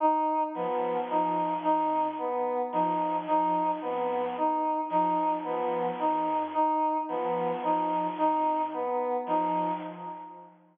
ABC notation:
X:1
M:6/8
L:1/8
Q:3/8=37
K:none
V:1 name="Ocarina" clef=bass
z F, F, F,, z F, | F, F,, z F, F, F,, | z F, F, F,, z F, |]
V:2 name="Lead 1 (square)"
^D B, D D B, D | ^D B, D D B, D | ^D B, D D B, D |]